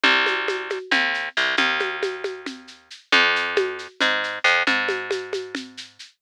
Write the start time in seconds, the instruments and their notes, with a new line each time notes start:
0.03 electric bass (finger) C2, low conga, shaker
0.26 high conga, shaker
0.48 high conga, shaker
0.70 high conga, shaker
0.91 electric bass (finger) D#2, low conga, shaker
1.14 shaker
1.37 electric bass (finger) C2, shaker
1.57 electric bass (finger) D#2, low conga, shaker
1.80 high conga, shaker
2.03 high conga, shaker
2.24 high conga, shaker
2.46 low conga, shaker
2.68 shaker
2.90 shaker
3.12 electric bass (finger) F2, low conga, shaker
3.36 shaker
3.56 high conga, shaker
3.79 shaker
4.00 electric bass (finger) G#2, low conga, shaker
4.24 shaker
4.44 electric bass (finger) F2, shaker
4.67 electric bass (finger) G#2, low conga, shaker
4.89 high conga, shaker
5.11 high conga, shaker
5.33 high conga, shaker
5.55 low conga, shaker
5.77 shaker
5.99 shaker